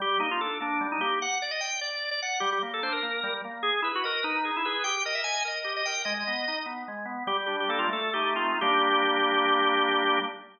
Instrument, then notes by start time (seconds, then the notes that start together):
drawbar organ
0.00 G3 G4
0.20 A#3 D#4
0.31 F4
0.41 D4 A4
0.60 A#3 D4
0.81 G3
0.92 D#4
1.01 A#3 G4
1.22 F#5
1.42 D5
1.51 D#5
1.61 G5
1.81 D5
2.11 D5
2.22 F#5
2.40 G3 G4
2.52 G4
2.63 A#3
2.74 A4
2.82 D4 C5
2.92 A#4
3.03 A#3
3.23 G3
3.45 A#3
3.63 G#4
3.82 E4 B4
3.95 F#4
4.04 A#4 D#5
4.23 D#4 B4
4.45 G#4
4.56 E4
4.65 G#4 B4
4.84 G4 G5
5.05 A#4 D#5
5.15 E5
5.24 D#5 G#5
5.45 A#4 D#5
5.64 G4
5.77 D#5
5.86 A#4 G5
6.05 G#3 D#5
6.14 D#5
6.27 B3
6.48 D#4
6.66 B3
6.88 G#3
7.05 B3
7.27 G3 G4
7.46 D4 G4
7.60 G4
7.69 A#3 A4
7.79 F4
7.89 A3 A4
8.14 D#4 G4
8.35 C4 F4
8.61 G3 A#3 D4 G4